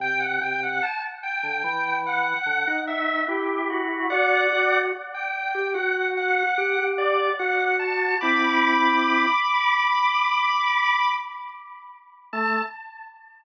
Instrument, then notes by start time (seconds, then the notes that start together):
drawbar organ
0.00 C3 G5
0.20 F#5
0.41 C3 G5
0.63 F#5
0.83 A5
1.23 G5
1.43 D3
1.64 E3
2.07 F#5
2.46 D3
2.67 D#4
2.87 E5
3.28 E4 G4
3.70 F#4
4.10 F#4 D5 F#5
4.52 F#4
5.14 G5
5.55 G4
5.74 F#4 F#5
6.17 F#5
6.58 G4
6.79 G4
6.98 D5
7.39 F#4 F#5
7.79 A5
8.21 C4 E4 B5 D6
12.33 A3 A5